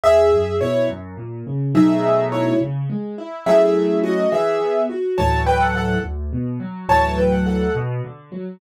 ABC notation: X:1
M:6/8
L:1/16
Q:3/8=70
K:E
V:1 name="Acoustic Grand Piano"
[Ge]4 [Ec]2 z6 | [Ge]4 [Ec]2 z6 | [Ge]4 [Fd]2 [Ge]4 z2 | [K:D] [ca]2 [Bg] [Af] [Af]2 z6 |
[ca]2 [Bg] [Af] [Af]2 z6 |]
V:2 name="Acoustic Grand Piano"
E,,2 F,,2 B,,2 F,,2 ^A,,2 C,2 | [B,,F,A,D]6 C,2 G,2 E2 | [F,A,CE]6 E,2 B,2 F2 | [K:D] [D,,A,,E,F,]6 D,,2 B,,2 F,2 |
[D,,A,,E,F,]6 B,,2 D,2 F,2 |]